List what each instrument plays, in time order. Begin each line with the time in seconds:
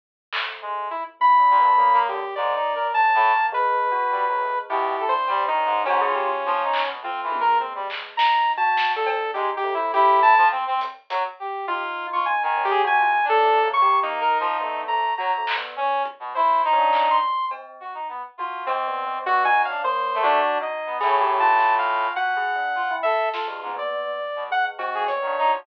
0.33 tubular bells A3, clap
0.62 brass section G#3
0.91 lead 2 (sawtooth) E4
1.20 tubular bells E4, lead 2 (sawtooth) B5, floor tom
1.39 tubular bells D4
1.50 brass section A#2
1.59 tubular bells B3, brass section D4
1.78 brass section A#3, tubular bells A#3
1.93 brass section A#3
2.08 brass section D3, lead 2 (sawtooth) G4
2.35 brass section G#2, tubular bells A#3, lead 2 (sawtooth) D5
2.55 brass section D#4
2.75 brass section A#4
2.94 brass section C#3, lead 2 (sawtooth) A5
3.14 brass section A2
3.33 brass section A#3
3.52 tubular bells G#3, lead 2 (sawtooth) B4
3.92 tubular bells F#4
4.11 brass section G3
4.27 brass section F#3, tubular bells G#3
4.40 brass section A2
4.70 brass section B2, tubular bells E4, lead 2 (sawtooth) G4
4.99 brass section A4
5.08 lead 2 (sawtooth) C5
5.13 tubular bells D4
5.28 brass section G3, cowbell
5.48 brass section D#3, lead 2 (sawtooth) D#4
5.57 tubular bells C#4
5.65 brass section G#2
5.85 brass section G#2, lead 2 (sawtooth) C#4, tubular bells F#4, cowbell
6.01 tubular bells G#4
6.06 brass section F4
6.15 tubular bells G4
6.24 brass section F4
6.44 brass section F3, high tom
6.64 brass section D#4
6.73 clap
6.83 brass section B2
7.03 tubular bells A3, brass section C4, lead 2 (sawtooth) F4
7.23 brass section E3
7.32 tubular bells G#3, high tom
7.40 brass section A#4
7.60 lead 2 (sawtooth) C4
7.75 brass section G3
7.90 clap
8.17 tubular bells D#4, lead 2 (sawtooth) A#5, snare
8.57 tubular bells F#4, lead 2 (sawtooth) A5
8.77 snare
8.96 tubular bells D4, lead 2 (sawtooth) A4
9.06 cowbell
9.34 brass section G#3, tubular bells D#4, lead 2 (sawtooth) G4, closed hi-hat
9.57 lead 2 (sawtooth) G4
9.64 tubular bells A3, kick
9.74 lead 2 (sawtooth) E4
9.94 brass section E4, lead 2 (sawtooth) G4, kick
10.22 lead 2 (sawtooth) A5
10.37 brass section F3
10.51 brass section C4
10.67 brass section C4
10.81 closed hi-hat
11.10 brass section F#3, closed hi-hat
11.40 brass section G4
11.68 tubular bells D#4, lead 2 (sawtooth) F4, brass section G4, kick
12.13 brass section F4, lead 2 (sawtooth) C#6
12.26 lead 2 (sawtooth) G#5
12.43 brass section D#3, lead 2 (sawtooth) G#5
12.56 tubular bells C#4, floor tom
12.65 lead 2 (sawtooth) G4
12.70 brass section G#4
12.84 brass section C3, tubular bells F#4, lead 2 (sawtooth) G#5
13.00 tubular bells F4
13.24 brass section D4
13.29 tubular bells C#4, lead 2 (sawtooth) A4
13.44 tubular bells A3
13.62 brass section A#3, tubular bells C#4
13.73 lead 2 (sawtooth) C#6
13.82 tubular bells G4
14.02 brass section A#3, lead 2 (sawtooth) D#4
14.20 brass section A#4
14.40 brass section F3
14.60 brass section A3, tubular bells B3
14.88 tubular bells A3, lead 2 (sawtooth) A#5
15.17 brass section F#3, tubular bells F#4, lead 2 (sawtooth) A#5
15.37 tubular bells A3
15.47 clap
15.57 tubular bells B3
15.76 brass section C#4, kick
16.05 kick
16.20 brass section B2
16.35 brass section E4, lead 2 (sawtooth) C5
16.65 brass section D#4
16.72 lead 2 (sawtooth) C#4
16.78 tubular bells D4
16.93 clap
17.10 lead 2 (sawtooth) C6
17.51 tubular bells C4, cowbell
17.80 brass section F#4
17.94 brass section D#4
18.09 brass section B3
18.38 brass section F4, tubular bells F#4
18.66 lead 2 (sawtooth) C4, tubular bells C4, cowbell
18.87 tubular bells B3
19.07 tubular bells C4
19.26 tubular bells B3, lead 2 (sawtooth) F#4, brass section F#4
19.45 tubular bells D#4, lead 2 (sawtooth) G#5
19.65 tubular bells C#4, lead 2 (sawtooth) F5
19.69 brass section D4
19.84 tubular bells A#3, lead 2 (sawtooth) C5
20.14 brass section A3
20.23 lead 2 (sawtooth) D4, tubular bells F#4
20.61 tubular bells D#4, lead 2 (sawtooth) D#5
20.86 brass section B3
21.01 brass section A2, lead 2 (sawtooth) C#4, tubular bells G#4, snare
21.20 tubular bells G4
21.40 tubular bells F4, lead 2 (sawtooth) A5
21.59 tubular bells F4, snare
21.79 lead 2 (sawtooth) F5
22.16 tubular bells F#4, lead 2 (sawtooth) F#5, floor tom
22.37 tubular bells G#4
22.56 tubular bells D4
22.75 brass section F4
22.91 tubular bells E4
23.03 brass section A4, lead 2 (sawtooth) E5
23.33 lead 2 (sawtooth) F4, brass section A4, snare
23.47 brass section G2, tubular bells G#3
23.62 brass section G#2, high tom
23.76 tubular bells B3, lead 2 (sawtooth) D5
24.36 brass section B2
24.50 tubular bells G#3, lead 2 (sawtooth) F#5, floor tom
24.79 tubular bells C4, lead 2 (sawtooth) F#4, cowbell
24.94 brass section G#4
25.07 tubular bells B3, lead 2 (sawtooth) C#5, closed hi-hat
25.22 brass section D#3
25.27 tubular bells D4
25.38 brass section D#4
25.47 tubular bells F#4
25.52 brass section F3